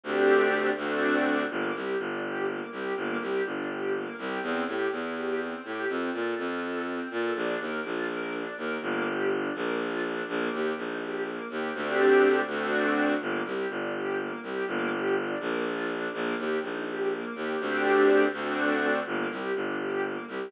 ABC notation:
X:1
M:6/8
L:1/8
Q:3/8=82
K:Gm
V:1 name="String Ensemble 1"
[A,CDG]3 [A,CD^F]3 | B, G D G B, G | B, G D G B, G | C G =E G C G |
C A F A C A | D B F B D B | B, G D B, F D | B, G E G B, G |
[A,CDG]3 [A,CD^F]3 | B, G D G B, G | B, G D B, F D | B, G E G B, G |
[A,CDG]3 [A,CD^F]3 | B, G D G B, G |]
V:2 name="Violin" clef=bass
D,,3 D,,3 | G,,, C,, G,,,3 C,, | G,,, C,, G,,,3 C,, | =E,, A,, E,,3 A,, |
F,, B,, F,,3 B,, | B,,, E,, B,,,3 E,, | G,,,3 B,,,3 | B,,, E,, B,,,3 E,, |
D,,3 D,,3 | G,,, C,, G,,,3 C,, | G,,,3 B,,,3 | B,,, E,, B,,,3 E,, |
D,,3 D,,3 | G,,, C,, G,,,3 C,, |]